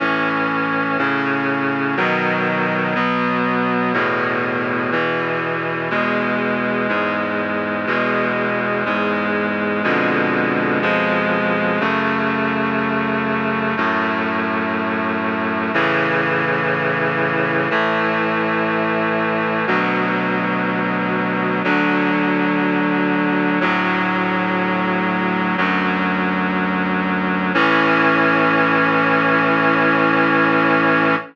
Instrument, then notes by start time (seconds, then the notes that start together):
clarinet
0.00 A2 E3 C#4
0.98 A2 C#3 C#4
1.97 B2 D#3 F#3
2.95 B2 F#3 B3
3.93 E2 A2 B2
4.92 E2 B2 E3
5.90 E2 B2 G#3
6.89 E2 G#2 G#3
7.87 E2 B2 G#3
8.85 E2 G#2 G#3
9.84 F2 B2 D3 G#3
10.82 F2 B2 F3 G#3
11.80 F#2 C#3 A3
13.77 F#2 A2 A3
15.74 A2 C#3 E3
17.70 A2 E3 A3
19.67 D2 B2 F#3
21.64 D2 D3 F#3
23.61 D2 A2 F#3
25.57 D2 F#2 F#3
27.54 A2 E3 C#4